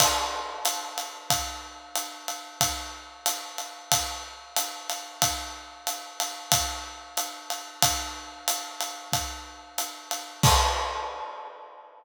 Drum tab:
CC |x-------|--------|--------|--------|
RD |x-xxx-xx|x-xxx-xx|x-xxx-xx|x-xxx-xx|
HH |--p---p-|--p---p-|--p---p-|--p---p-|
BD |o---o---|o---o---|o---o---|o---o---|

CC |x-------|
RD |--------|
HH |--------|
BD |o-------|